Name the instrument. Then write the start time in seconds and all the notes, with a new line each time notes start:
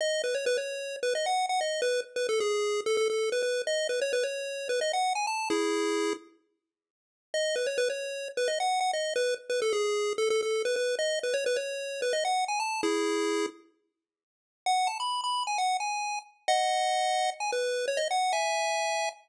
lead 1 (square)
0.01 D#5
0.24 B4
0.35 C#5
0.46 B4
0.58 C#5
1.03 B4
1.15 D#5
1.26 F#5
1.49 F#5
1.61 D#5
1.82 B4
2.16 B4
2.29 A4
2.40 G#4
2.86 A4
2.97 A4
3.10 A4
3.32 B4
3.43 B4
3.67 D#5
3.89 B4
4.02 C#5
4.13 B4
4.23 C#5
4.69 B4
4.81 D#5
4.93 F#5
5.15 G#5
5.27 A5
5.50 E4 G#4
7.34 D#5
7.56 B4
7.67 C#5
7.78 B4
7.90 C#5
8.37 B4
8.48 D#5
8.60 F#5
8.81 F#5
8.93 D#5
9.16 B4
9.50 B4
9.62 A4
9.73 G#4
10.18 A4
10.30 A4
10.42 A4
10.65 B4
10.76 B4
10.99 D#5
11.23 B4
11.34 C#5
11.46 B4
11.56 C#5
12.02 B4
12.13 D#5
12.25 F#5
12.48 G#5
12.60 A5
12.83 E4 G#4
14.66 F#5
14.87 A5
15.00 B5
15.24 B5
15.47 G#5
15.58 F#5
15.80 G#5
16.48 D#5 F#5
17.40 G#5
17.52 B4
17.88 C#5
17.97 D#5
18.11 F#5
18.33 E5 G#5